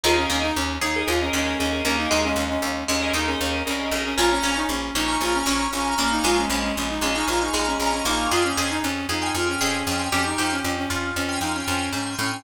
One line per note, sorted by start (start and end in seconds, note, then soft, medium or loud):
0.04 0.26 D#2 medium
0.04 0.25 D#4 medium
0.04 0.16 F4 loud
0.04 0.47 G#4 loud
0.04 0.47 A#4 medium
0.04 0.47 D#5 medium
0.17 0.29 C#4 medium
0.30 0.52 D#2 medium
0.30 0.42 C#4 medium
0.30 0.72 D#4 medium
0.42 0.54 D#4 medium
0.56 0.78 D#2 medium
0.56 0.77 C#4 medium
0.81 1.03 D#2 medium
0.81 1.05 D#4 medium
0.81 1.24 G#4 medium
0.96 1.06 G#4 medium
0.96 1.06 A#4 medium
0.96 1.06 D#5 medium
1.06 1.30 D#2 medium
1.06 1.20 F4 medium
1.06 1.17 G#4 medium
1.06 1.17 A#4 medium
1.06 1.17 D#5 medium
1.21 1.33 C#4 medium
1.21 1.52 G#4 medium
1.21 1.52 A#4 medium
1.21 1.52 D#5 medium
1.33 1.55 D#2 medium
1.33 1.84 G#3 medium
1.33 1.58 C#4 loud
1.59 1.82 D#2 medium
1.59 1.82 C#4 loud
1.59 1.69 G#4 medium
1.59 1.69 A#4 medium
1.59 1.69 D#5 medium
1.73 1.83 G#4 medium
1.73 1.83 A#4 medium
1.73 1.83 D#5 medium
1.84 2.07 D#2 medium
1.84 2.09 A#3 medium
1.84 1.97 C#4 medium
1.84 2.27 G#4 medium
1.84 2.27 A#4 medium
1.84 2.27 D#5 medium
1.98 2.10 D#4 medium
2.10 2.34 D#2 medium
2.10 2.59 G#3 medium
2.10 2.22 D#4 medium
2.24 2.36 C#4 medium
2.36 2.58 D#2 medium
2.36 2.49 C#4 medium
2.49 2.62 C#4 medium
2.62 2.84 D#2 medium
2.62 2.84 C#4 medium
2.88 3.11 D#2 medium
2.88 3.12 G#3 medium
2.88 3.13 C#4 medium
3.02 3.12 G#4 medium
3.02 3.12 A#4 medium
3.02 3.12 D#5 medium
3.13 3.35 D#2 medium
3.13 3.64 D#4 medium
3.13 3.27 D#4 medium
3.13 3.25 G#4 medium
3.13 3.25 A#4 medium
3.13 3.25 D#5 medium
3.27 3.39 C#4 medium
3.27 3.59 G#4 medium
3.27 3.59 A#4 medium
3.27 3.59 D#5 medium
3.40 3.63 D#2 medium
3.40 3.62 C#4 medium
3.65 3.90 C2 medium
3.65 3.91 C#4 medium
3.65 3.76 G#4 medium
3.65 3.76 A#4 medium
3.65 3.76 D#5 medium
3.79 3.90 G#4 medium
3.79 3.90 A#4 medium
3.79 3.90 D#5 medium
3.91 4.15 B1 medium
3.91 4.04 C#4 medium
3.91 4.12 G#4 medium
3.91 4.12 A#4 medium
3.91 4.12 D#5 medium
4.05 4.18 C#4 medium
4.17 4.40 A#1 medium
4.17 4.39 C#4 medium
4.17 4.30 F4 loud
4.17 4.59 G#5 medium
4.17 4.59 A#5 medium
4.17 4.59 C#6 medium
4.17 4.59 F6 medium
4.31 4.43 C#4 medium
4.43 4.65 A#1 medium
4.43 4.88 C#4 medium
4.43 4.56 C#4 loud
4.56 4.68 D#4 medium
4.69 4.91 A#1 medium
4.69 4.94 C#4 medium
4.95 5.17 A#1 medium
4.95 5.43 C#4 medium
4.95 5.18 D#4 medium
5.08 5.18 G#5 medium
5.08 5.18 A#5 medium
5.08 5.18 C#6 medium
5.08 5.18 F6 medium
5.21 5.43 A#1 medium
5.21 5.34 F4 medium
5.21 5.33 G#5 medium
5.21 5.33 A#5 medium
5.21 5.33 C#6 medium
5.21 5.33 F6 medium
5.34 5.46 C#4 medium
5.34 5.66 G#5 medium
5.34 5.66 A#5 medium
5.34 5.66 C#6 medium
5.34 5.66 F6 medium
5.46 5.68 A#1 medium
5.46 5.68 C#4 medium
5.46 5.97 C#4 medium
5.73 5.95 A#1 medium
5.73 5.94 C#4 medium
5.73 5.84 G#5 medium
5.73 5.84 A#5 medium
5.73 5.84 C#6 medium
5.73 5.84 F6 medium
5.84 5.95 G#5 medium
5.84 5.95 A#5 medium
5.84 5.95 C#6 medium
5.84 5.95 F6 medium
5.98 6.20 A#1 medium
5.98 6.23 A#3 medium
5.98 6.10 C#4 medium
5.98 6.41 G#5 medium
5.98 6.41 A#5 medium
5.98 6.41 C#6 medium
5.98 6.41 F6 medium
6.11 6.24 D#4 medium
6.24 6.46 A#1 medium
6.24 6.48 G#3 medium
6.24 6.37 F4 loud
6.38 6.49 C#4 medium
6.50 6.72 A#1 medium
6.50 7.01 G#3 medium
6.50 6.62 C#4 medium
6.63 6.75 C#4 medium
6.76 6.99 A#1 medium
6.76 6.88 C#4 medium
6.90 7.02 D#4 medium
7.01 7.23 A#1 medium
7.01 7.53 G#3 medium
7.01 7.15 C#4 medium
7.15 7.27 D#4 medium
7.15 7.25 G#5 medium
7.15 7.25 A#5 medium
7.15 7.25 C#6 medium
7.15 7.25 F6 medium
7.28 7.50 A#1 medium
7.28 7.41 F4 medium
7.28 7.39 G#5 medium
7.28 7.39 A#5 medium
7.28 7.39 C#6 medium
7.28 7.39 F6 medium
7.41 7.65 D#4 medium
7.41 7.72 G#5 medium
7.41 7.72 A#5 medium
7.41 7.72 C#6 medium
7.41 7.72 F6 medium
7.54 7.76 A#1 medium
7.54 8.04 G#3 medium
7.67 7.79 C#4 medium
7.79 8.02 A#1 medium
7.79 7.92 C#4 medium
7.79 7.91 G#5 medium
7.79 7.91 A#5 medium
7.79 7.91 C#6 medium
7.79 7.91 F6 medium
7.92 8.05 C#4 medium
7.92 8.02 G#5 medium
7.92 8.02 A#5 medium
7.92 8.02 C#6 medium
7.92 8.02 F6 medium
8.05 8.27 A#1 medium
8.05 8.28 A#3 medium
8.05 8.28 D#4 medium
8.05 8.26 G#5 medium
8.05 8.26 A#5 medium
8.05 8.26 C#6 medium
8.05 8.26 F6 medium
8.31 8.53 F2 medium
8.31 8.43 F4 loud
8.31 8.53 G#4 medium
8.31 8.72 G5 medium
8.31 8.72 G#5 medium
8.31 8.72 C6 medium
8.31 8.72 F6 medium
8.44 8.57 C#4 medium
8.57 8.80 F2 medium
8.57 8.70 C#4 medium
8.57 9.03 G#4 medium
8.70 8.82 D#4 medium
8.83 9.06 F2 medium
8.83 9.06 C#4 medium
9.09 9.31 F2 medium
9.09 9.35 D#4 medium
9.09 9.54 G#4 medium
9.22 9.32 G5 medium
9.22 9.32 G#5 medium
9.22 9.32 C6 medium
9.22 9.32 F6 medium
9.35 9.57 F2 medium
9.35 9.48 F4 medium
9.35 9.45 G5 medium
9.35 9.45 G#5 medium
9.35 9.45 C6 medium
9.35 9.45 F6 medium
9.46 9.60 C#4 medium
9.46 9.77 G5 medium
9.46 9.77 G#5 medium
9.46 9.77 C6 medium
9.46 9.77 F6 medium
9.61 9.83 F2 medium
9.61 9.85 C#4 medium
9.61 10.10 G#4 medium
9.87 10.09 F2 medium
9.87 10.09 C#4 medium
9.87 9.97 G5 medium
9.87 9.97 G#5 medium
9.87 9.97 C6 medium
9.87 9.97 F6 medium
9.99 10.09 G5 medium
9.99 10.09 G#5 medium
9.99 10.09 C6 medium
9.99 10.09 F6 medium
10.12 10.34 F2 medium
10.12 10.24 C#4 medium
10.12 10.36 G4 medium
10.12 10.55 G5 medium
10.12 10.55 G#5 medium
10.12 10.55 C6 medium
10.12 10.55 F6 medium
10.25 10.38 D#4 medium
10.38 10.61 F2 medium
10.38 10.51 D#4 medium
10.38 10.82 G4 medium
10.52 10.63 C#4 medium
10.63 10.86 F2 medium
10.63 10.76 C#4 medium
10.78 10.89 C#4 medium
10.90 11.12 F2 medium
10.90 11.11 C#4 medium
10.90 11.82 F4 medium
11.16 11.38 F2 medium
11.16 11.41 C#4 medium
11.29 11.39 G5 medium
11.29 11.39 G#5 medium
11.29 11.39 C6 medium
11.29 11.39 F6 medium
11.41 11.63 F2 medium
11.41 11.54 D#4 medium
11.41 11.52 G5 medium
11.41 11.52 G#5 medium
11.41 11.52 C6 medium
11.41 11.52 F6 medium
11.55 11.67 C#4 medium
11.55 11.87 G5 medium
11.55 11.87 G#5 medium
11.55 11.87 C6 medium
11.55 11.87 F6 medium
11.68 11.90 F2 medium
11.68 11.92 C#4 medium
11.93 12.16 G#2 medium
11.93 12.15 C#4 medium
11.93 12.04 G5 medium
11.93 12.04 G#5 medium
11.93 12.04 C6 medium
11.93 12.04 F6 medium
12.06 12.16 G5 medium
12.06 12.16 G#5 medium
12.06 12.16 C6 medium
12.06 12.16 F6 medium
12.19 12.42 A2 medium
12.19 12.31 C#4 medium
12.19 12.41 G5 medium
12.19 12.41 G#5 medium
12.19 12.41 C6 medium
12.19 12.41 F6 medium
12.32 12.44 C#4 medium